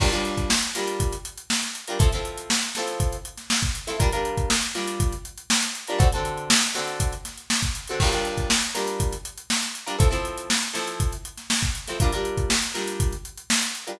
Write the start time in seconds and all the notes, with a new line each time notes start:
0.00 G3 D4 F4 A#4, kick, crash
0.12 G3 D4 F4 A#4, closed hi-hat
0.25 closed hi-hat
0.38 kick, closed hi-hat
0.50 snare
0.62 closed hi-hat
0.75 G3 D4 F4 A#4, snare, closed hi-hat
0.88 closed hi-hat
1.00 kick, closed hi-hat
1.12 closed hi-hat
1.25 closed hi-hat
1.38 closed hi-hat
1.50 snare
1.62 snare, closed hi-hat
1.75 closed hi-hat
1.88 G3 D4 F4 A#4, closed hi-hat
1.99 F3 C4 E4 A4, kick, closed hi-hat
2.12 F3 C4 E4 A4, snare, closed hi-hat
2.25 closed hi-hat
2.38 closed hi-hat
2.50 snare
2.62 closed hi-hat
2.75 F3 C4 E4 A4, snare, closed hi-hat
2.88 closed hi-hat
3.00 kick, closed hi-hat
3.12 closed hi-hat
3.25 closed hi-hat
3.38 snare, closed hi-hat
3.50 snare
3.62 kick, closed hi-hat
3.75 closed hi-hat
3.87 F3 C4 E4 A4, snare, closed hi-hat
3.99 G3 D4 F4 A#4, kick, closed hi-hat
4.12 G3 D4 F4 A#4, closed hi-hat
4.25 closed hi-hat
4.38 kick, closed hi-hat
4.50 snare
4.62 closed hi-hat
4.74 G3 D4 F4 A#4, snare, closed hi-hat
4.88 closed hi-hat
5.00 kick, closed hi-hat
5.12 closed hi-hat
5.25 closed hi-hat
5.38 closed hi-hat
5.50 snare
5.62 snare, closed hi-hat
5.75 closed hi-hat
5.88 G3 D4 F4 A#4, closed hi-hat
5.99 D3 C4 F#4 A4, kick, closed hi-hat
6.12 D3 C4 F#4 A4, closed hi-hat
6.25 closed hi-hat
6.38 closed hi-hat
6.50 snare
6.62 snare, closed hi-hat
6.74 D3 C4 F#4 A4, snare, closed hi-hat
6.88 closed hi-hat
7.00 kick, closed hi-hat
7.12 closed hi-hat
7.25 snare, closed hi-hat
7.38 closed hi-hat
7.50 snare
7.62 kick, closed hi-hat
7.75 closed hi-hat
7.88 D3 C4 F#4 A4, closed hi-hat
8.00 G3 D4 F4 A#4, kick, crash
8.12 G3 D4 F4 A#4, closed hi-hat
8.25 closed hi-hat
8.38 kick, closed hi-hat
8.50 snare
8.62 closed hi-hat
8.75 G3 D4 F4 A#4, snare, closed hi-hat
8.88 closed hi-hat
9.00 kick, closed hi-hat
9.12 closed hi-hat
9.25 closed hi-hat
9.38 closed hi-hat
9.50 snare
9.62 snare, closed hi-hat
9.75 closed hi-hat
9.86 G3 D4 F4 A#4, closed hi-hat
9.99 F3 C4 E4 A4, kick, closed hi-hat
10.11 F3 C4 E4 A4, snare, closed hi-hat
10.25 closed hi-hat
10.38 closed hi-hat
10.50 snare
10.62 closed hi-hat
10.73 F3 C4 E4 A4, snare, closed hi-hat
10.88 closed hi-hat
11.00 kick, closed hi-hat
11.12 closed hi-hat
11.25 closed hi-hat
11.38 snare, closed hi-hat
11.50 snare
11.62 kick, closed hi-hat
11.75 closed hi-hat
11.88 F3 C4 E4 A4, snare, closed hi-hat
12.00 G3 D4 F4 A#4, kick, closed hi-hat
12.12 G3 D4 F4 A#4, closed hi-hat
12.25 closed hi-hat
12.38 kick, closed hi-hat
12.50 snare
12.62 closed hi-hat
12.74 G3 D4 F4 A#4, snare, closed hi-hat
12.88 closed hi-hat
13.00 kick, closed hi-hat
13.12 closed hi-hat
13.25 closed hi-hat
13.38 closed hi-hat
13.50 snare
13.62 snare, closed hi-hat
13.75 closed hi-hat
13.87 G3 D4 F4 A#4, closed hi-hat